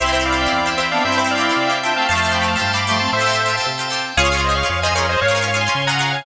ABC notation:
X:1
M:2/2
L:1/16
Q:1/2=115
K:C
V:1 name="Lead 1 (square)"
[ce]2 [ce]2 [df]8 [ce]2 [df]2 | [ce]2 [ce]2 [df]8 [eg]2 [fa]2 | [fa]4 [gb]2 [fa]4 [bd']4 [ac']2 | [ce]8 z8 |
[K:Db] [df]4 [ce]2 [df]2 [df]2 [ce]2 [Bd]2 [ce]2 | [df]4 [df]2 [ac']4 [gb]4 [fa]2 |]
V:2 name="Clarinet"
[CE]12 [CE]2 [B,D]2 | [CE]12 [DF]2 [A,C]2 | [F,A,]8 z4 [F,A,]2 [A,C]2 | [Ac]6 z10 |
[K:Db] [FA]8 z4 [FA]2 [Ac]2 | [Bd]4 z12 |]
V:3 name="Pizzicato Strings"
[CEG] [CEG] [CEG] [CEG]2 [CEG]2 [CEG]3 [CEG]2 [CEG]4- | [CEG] [CEG] [CEG] [CEG]2 [CEG]2 [CEG]3 [CEG]2 [CEG]4 | [CFGA] [CFGA] [CFGA] [CFGA]2 [CFGA]2 [CFGA]3 [CFGA]2 [CFGA]4- | [CFGA] [CFGA] [CFGA] [CFGA]2 [CFGA]2 [CFGA]3 [CFGA]2 [CFGA]4 |
[K:Db] [DFA] [DFA] [DFA] [DFA]2 [DFA]2 [DFA]3 [DFA]2 [DFA]4- | [DFA] [DFA] [DFA] [DFA]2 [DFA]2 [DFA]3 [DFA]2 [DFA]4 |]
V:4 name="Drawbar Organ"
c2 g2 c2 e2 c2 g2 e2 c2 | c2 g2 c2 e2 c2 g2 e2 c2 | c2 f2 g2 a2 c2 f2 g2 a2 | c2 f2 g2 a2 c2 f2 g2 a2 |
[K:Db] d2 a2 d2 f2 d2 a2 f2 d2 | d2 a2 d2 f2 d2 a2 f2 d2 |]
V:5 name="Synth Bass 1" clef=bass
C,,8 E,,8 | G,,8 C,8 | F,,8 G,,8 | A,,8 C,8 |
[K:Db] D,,8 F,,8 | A,,8 D,8 |]